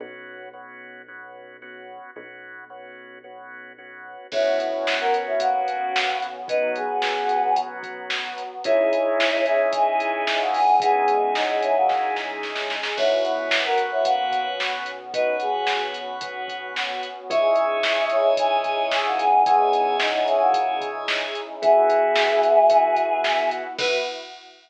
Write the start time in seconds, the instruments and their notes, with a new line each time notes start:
0.00 synth bass 1 B1, drawbar organ B3 C#4 F#4
0.53 drawbar organ B3 C#4 F#4
1.08 drawbar organ B3 C#4 F#4
1.62 drawbar organ B3 C#4 F#4
2.16 synth bass 1 B1, drawbar organ B3 C#4 F#4
2.70 drawbar organ B3 C#4 F#4
3.24 drawbar organ B3 C#4 F#4
3.78 drawbar organ B3 C#4 F#4
4.32 synth bass 1 B1, drawbar organ B3 C#4 F#4, pad 5 (bowed) B3 C#4 F#4, choir aahs E4 C#5, kick, crash
4.59 choir aahs E4 C#5, closed hi-hat
4.87 snare
5.00 choir aahs A#4 F#5
5.14 closed hi-hat
5.27 choir aahs E4 C#5
5.40 choir aahs A#3 F#4, kick, closed hi-hat
5.68 closed hi-hat
5.96 snare
6.22 closed hi-hat
6.48 pad 5 (bowed) F#3 B3 F#4, drawbar organ B3 C#4 F#4, choir aahs D#4 B4, kick, closed hi-hat
6.76 choir aahs B3 G#4, closed hi-hat
7.02 snare
7.29 closed hi-hat
7.56 kick, closed hi-hat
7.83 kick, closed hi-hat
8.10 snare
8.38 closed hi-hat
8.64 synth bass 1 C#2, pad 5 (bowed) C#4 D#4 E4 G#4, drawbar organ C#4 D#4 E4 G#4, choir aahs E4 C#5, kick, closed hi-hat
8.93 closed hi-hat
9.20 snare
9.46 choir aahs E4 C#5, closed hi-hat
9.73 choir aahs E3 C#4, kick, closed hi-hat
10.00 closed hi-hat
10.27 choir aahs E3 C#4, snare
10.41 choir aahs A#3 F#4
10.54 choir aahs B3 G#4, open hi-hat
10.80 pad 5 (bowed) G#3 C#4 D#4 G#4, choir aahs B3 G#4, drawbar organ C#4 D#4 E4 G#4, kick, closed hi-hat
11.08 closed hi-hat
11.35 choir aahs F#3 D#4, snare
11.49 choir aahs F#3 D#4
11.62 choir aahs E3 C#4, closed hi-hat
11.76 choir aahs A#3 F#4
11.89 kick, snare
12.16 snare
12.43 snare
12.56 snare
12.70 snare
12.83 snare
12.97 synth bass 1 B1, pad 5 (bowed) B3 C#4 F#4, choir aahs E4 C#5, drawbar organ B4 C#5 F#5, kick, crash
13.24 choir aahs E4 C#5, closed hi-hat
13.51 snare
13.65 choir aahs A#4 F#5
13.78 closed hi-hat
13.92 choir aahs E4 C#5
14.05 choir aahs A#3 F#4, kick, closed hi-hat
14.31 kick, closed hi-hat
14.60 snare
14.86 closed hi-hat
15.14 choir aahs D#4 B4, drawbar organ B4 C#5 F#5, kick, closed hi-hat
15.40 choir aahs B3 G#4, closed hi-hat
15.67 snare
15.94 closed hi-hat
16.21 kick, closed hi-hat
16.48 kick, closed hi-hat
16.76 snare
17.03 closed hi-hat
17.30 synth bass 1 C#2, pad 5 (bowed) C#4 D#4 E4 G#4, drawbar organ C#5 D#5 E5 G#5, choir aahs E5 C#6, kick, closed hi-hat
17.56 closed hi-hat
17.83 snare
18.10 choir aahs E4 C#5, closed hi-hat
18.37 choir aahs E3 C#4, kick, closed hi-hat
18.64 kick, closed hi-hat
18.91 choir aahs E3 C#4, snare
19.05 choir aahs A#3 F#4
19.19 choir aahs B3 G#4, closed hi-hat
19.46 choir aahs B3 G#4, drawbar organ C#5 D#5 E5 G#5, kick, closed hi-hat
19.73 closed hi-hat
20.00 choir aahs F#3 D#4, snare
20.14 choir aahs F#3 D#4
20.27 choir aahs E3 C#4, closed hi-hat
20.41 choir aahs A#3 F#4
20.54 kick, closed hi-hat
20.81 kick, closed hi-hat
21.08 snare
21.35 closed hi-hat
21.62 synth bass 1 B1, drawbar organ B3 E4 F#4, pad 5 (bowed) B3 E4 F#4, choir aahs G#4 E5, kick, closed hi-hat
21.90 closed hi-hat
22.16 snare
22.43 closed hi-hat
22.70 drawbar organ B3 E4 F#4, kick, closed hi-hat
22.96 kick, closed hi-hat
23.24 snare
23.51 closed hi-hat
23.78 synth bass 1 B1, pad 5 (bowed) B3 E4 F#4, drawbar organ B3 E4 F#4, choir aahs B4, kick, crash